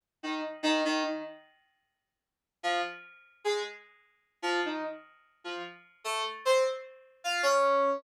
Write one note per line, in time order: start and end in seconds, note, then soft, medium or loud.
0.23 0.41 D#3 medium
0.63 0.81 D#3 loud
0.85 1.03 D#3 loud
1.03 1.21 D#3 medium
2.63 2.81 F3 loud
3.44 3.62 G#3 medium
4.42 4.60 F3 loud
4.65 4.83 D#3 medium
5.44 5.62 F3 medium
6.04 6.22 A3 loud
6.45 6.63 C4 loud
7.24 7.42 F4 loud
7.43 7.97 C#4 loud